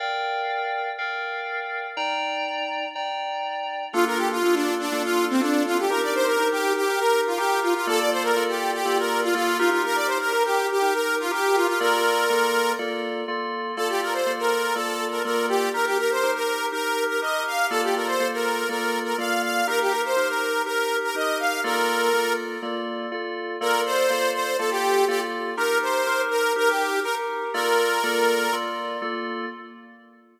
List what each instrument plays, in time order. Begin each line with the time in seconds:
0.00 electric piano 2 A#4 D5 F5 G5
0.98 electric piano 2 A#4 D5 F5 G5
1.97 electric piano 2 D#4 D5 G5 A#5
2.95 electric piano 2 D#4 D5 G5 A#5
3.93 electric piano 2 A#3 D4 F4 A4, lead 2 (sawtooth) F4
4.06 lead 2 (sawtooth) A#4
4.17 lead 2 (sawtooth) G4
4.31 lead 2 (sawtooth) F4
4.43 electric piano 2 A#3 D4 F4 A4
4.55 lead 2 (sawtooth) D4
4.79 lead 2 (sawtooth) D4
4.92 electric piano 2 A#3 D4 F4 A4
5.04 lead 2 (sawtooth) F4
5.30 lead 2 (sawtooth) C4
5.40 electric piano 2 A#3 D4 F4 A4, lead 2 (sawtooth) D4
5.66 lead 2 (sawtooth) F4
5.79 lead 2 (sawtooth) G4
5.90 electric piano 2 D#4 G4 A#4, lead 2 (sawtooth) A#4
6.02 lead 2 (sawtooth) D5
6.15 lead 2 (sawtooth) C5
6.26 lead 2 (sawtooth) A#4
6.39 electric piano 2 D#4 G4 A#4
6.52 lead 2 (sawtooth) G4
6.76 lead 2 (sawtooth) G4
6.89 electric piano 2 D#4 G4 A#4
6.99 lead 2 (sawtooth) A#4
7.27 lead 2 (sawtooth) F4
7.37 electric piano 2 D#4 G4 A#4, lead 2 (sawtooth) G4
7.62 lead 2 (sawtooth) F4
7.75 lead 2 (sawtooth) F4
7.87 electric piano 2 A#3 F4 A4 D5, lead 2 (sawtooth) A4
7.99 lead 2 (sawtooth) D5
8.11 lead 2 (sawtooth) C5
8.23 lead 2 (sawtooth) A#4
8.36 electric piano 2 A#3 F4 A4 D5
8.49 lead 2 (sawtooth) G4
8.74 lead 2 (sawtooth) G4
8.85 electric piano 2 A#3 F4 A4 D5
8.99 lead 2 (sawtooth) A#4
9.23 lead 2 (sawtooth) F4
9.34 electric piano 2 A#3 F4 A4 D5, lead 2 (sawtooth) F4
9.58 electric piano 2 D#4 G4 A#4, lead 2 (sawtooth) F4
9.71 lead 2 (sawtooth) F4
9.85 lead 2 (sawtooth) A#4
9.95 lead 2 (sawtooth) D5
10.07 lead 2 (sawtooth) C5
10.20 lead 2 (sawtooth) A#4
10.33 electric piano 2 D#4 G4 A#4
10.45 lead 2 (sawtooth) G4
10.71 lead 2 (sawtooth) G4
10.82 electric piano 2 D#4 G4 A#4
10.94 lead 2 (sawtooth) A#4
11.20 lead 2 (sawtooth) F4
11.31 electric piano 2 D#4 G4 A#4, lead 2 (sawtooth) G4
11.56 lead 2 (sawtooth) F4
11.67 lead 2 (sawtooth) F4
11.80 electric piano 2 A#3 F4 A4 D5, lead 2 (sawtooth) A#4
12.30 electric piano 2 A#3 F4 A4 D5
12.79 electric piano 2 A#3 F4 A4 D5
13.28 electric piano 2 A#3 F4 A4 D5
13.77 electric piano 2 A#3 F4 A4 D5, lead 2 (sawtooth) A4
13.89 lead 2 (sawtooth) G4
14.02 lead 2 (sawtooth) A#4
14.12 lead 2 (sawtooth) C5
14.26 electric piano 2 A#3 F4 A4 D5
14.39 lead 2 (sawtooth) A#4
14.74 electric piano 2 A#3 F4 A4 D5, lead 2 (sawtooth) A4
15.11 lead 2 (sawtooth) A#4
15.25 electric piano 2 A#3 F4 A4 D5, lead 2 (sawtooth) A#4
15.49 lead 2 (sawtooth) G4
15.74 electric piano 2 D#4 G4 A#4, lead 2 (sawtooth) A#4
15.86 lead 2 (sawtooth) G4
15.99 lead 2 (sawtooth) A#4
16.11 lead 2 (sawtooth) C5
16.23 electric piano 2 D#4 G4 A#4
16.35 lead 2 (sawtooth) A#4
16.72 electric piano 2 D#4 G4 A#4, lead 2 (sawtooth) A#4
17.09 lead 2 (sawtooth) A#4
17.21 electric piano 2 D#4 G4 A#4, lead 2 (sawtooth) D#5
17.47 lead 2 (sawtooth) F5
17.70 electric piano 2 A#3 F4 A4 D5, lead 2 (sawtooth) A4
17.83 lead 2 (sawtooth) G4
17.96 lead 2 (sawtooth) A#4
18.07 lead 2 (sawtooth) C5
18.20 electric piano 2 A#3 F4 A4 D5
18.34 lead 2 (sawtooth) A#4
18.69 electric piano 2 A#3 F4 A4 D5, lead 2 (sawtooth) A#4
19.05 lead 2 (sawtooth) A#4
19.18 electric piano 2 A#3 F4 A4 D5, lead 2 (sawtooth) F5
19.43 lead 2 (sawtooth) F5
19.67 electric piano 2 D#4 G4 A#4, lead 2 (sawtooth) A#4
19.81 lead 2 (sawtooth) G4
19.90 lead 2 (sawtooth) A#4
20.05 lead 2 (sawtooth) C5
20.16 electric piano 2 D#4 G4 A#4
20.28 lead 2 (sawtooth) A#4
20.66 electric piano 2 D#4 G4 A#4, lead 2 (sawtooth) A#4
21.04 lead 2 (sawtooth) A#4
21.15 electric piano 2 D#4 G4 A#4, lead 2 (sawtooth) D#5
21.39 lead 2 (sawtooth) F5
21.64 electric piano 2 A#3 F4 A4 D5, lead 2 (sawtooth) A#4
22.13 electric piano 2 A#3 F4 A4 D5
22.62 electric piano 2 A#3 F4 A4 D5
23.11 electric piano 2 A#3 F4 A4 D5
23.61 electric piano 2 A#3 F4 A4 D5, lead 2 (sawtooth) A#4
23.85 lead 2 (sawtooth) C5
24.10 electric piano 2 A#3 F4 A4 D5
24.34 lead 2 (sawtooth) C5
24.58 electric piano 2 A#3 F4 A4 D5, lead 2 (sawtooth) A4
24.71 lead 2 (sawtooth) G4
25.08 electric piano 2 A#3 F4 A4 D5, lead 2 (sawtooth) G4
25.57 electric piano 2 D#4 G4 A#4, lead 2 (sawtooth) A#4
25.82 lead 2 (sawtooth) C5
26.07 electric piano 2 D#4 G4 A#4
26.30 lead 2 (sawtooth) A#4
26.56 electric piano 2 D#4 G4 A#4, lead 2 (sawtooth) A#4
26.68 lead 2 (sawtooth) G4
27.03 electric piano 2 D#4 G4 A#4, lead 2 (sawtooth) A#4
27.54 electric piano 2 A#3 F4 A4 D5, lead 2 (sawtooth) A#4
28.03 electric piano 2 A#3 F4 A4 D5
28.53 electric piano 2 A#3 F4 A4 D5
29.02 electric piano 2 A#3 F4 A4 D5